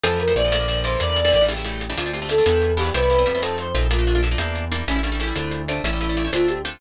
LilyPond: <<
  \new Staff \with { instrumentName = "Choir Aahs" } { \time 6/8 \key d \minor \tempo 4. = 124 a'8 bes'8 d''4. c''8 | d''4. g'4. | f'8 g'8 a'4. g'8 | b'4. a'8 c''8 r8 |
f'4 r2 | cis'8 d'8 e'4. d'8 | e'4. f'8 g'8 r8 | }
  \new Staff \with { instrumentName = "Acoustic Guitar (steel)" } { \time 6/8 \key d \minor <e f a c'>8. <e f a c'>16 <e f a c'>16 <e f a c'>16 <d f a bes>16 <d f a bes>16 <d f a bes>8 <d e g bes>8~ | <d e g bes>8. <d e g bes>16 <d e g bes>16 <d e g bes>16 <cis e g a>16 <cis e g a>16 <cis e g a>8. <cis e g a>16 | <a c' d' f'>16 <a c' d' f'>16 <a c' d' f'>16 <a c' d' f'>16 <a c' d' f'>16 <a c' d' f'>16 <g b d' e'>4 <g b d' e'>8 | <g b c' e'>16 <g b c' e'>16 <g b c' e'>16 <g b c' e'>16 <g b c' e'>16 <g b c' e'>16 <a c' ees' f'>4 <a c' ees' f'>8 |
<a bes d' f'>16 <a bes d' f'>16 <a bes d' f'>16 <a bes d' f'>16 <a bes d' f'>16 <a bes d' f'>16 <g bes d' e'>4 <g bes d' e'>8 | <g a cis' e'>16 <g a cis' e'>16 <g a cis' e'>16 <g a cis' e'>16 <g a cis' e'>16 <g a cis' e'>16 <a c' d' f'>4 <a c' d' f'>8 | <g a cis' e'>16 <g a cis' e'>16 <g a cis' e'>16 <g a cis' e'>16 <g a cis' e'>16 <g a cis' e'>16 <a c' d' f'>4 <a c' d' f'>8 | }
  \new Staff \with { instrumentName = "Synth Bass 1" } { \clef bass \time 6/8 \key d \minor f,4 bes,,2 | e,4 a,,2 | d,4. e,4. | c,4 f,4. bes,,8~ |
bes,,4. e,4. | a,,4. d,4. | a,,4. d,4. | }
  \new DrumStaff \with { instrumentName = "Drums" } \drummode { \time 6/8 hh8 hh8 hh8 hh8 hh8 hh8 | hh8 hh8 hh8 hh8 hh8 hh8 | hh8 hh8 hh8 hh8 hh8 hho8 | hh8 hh8 hh8 hh8 hh8 hh8 |
hh8 hh8 hh8 hh8 hh8 hh8 | hh8 hh8 hh8 hh8 hh8 hh8 | hh8 hh8 hh8 hh8 hh8 hh8 | }
>>